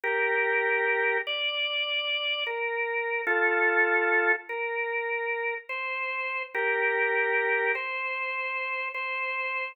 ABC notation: X:1
M:4/4
L:1/8
Q:1/4=74
K:Bb
V:1 name="Drawbar Organ"
[GB]3 d3 B2 | [FA]3 B3 c2 | [GB]3 c3 c2 |]